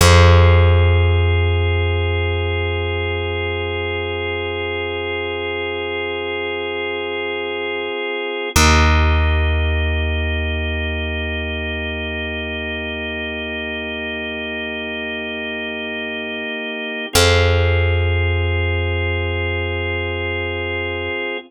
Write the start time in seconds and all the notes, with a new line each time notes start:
0.01 F2 C4 F4 G#4
8.56 D#2 A#3 D#4 G4
17.13 F2 C4 F4 G#4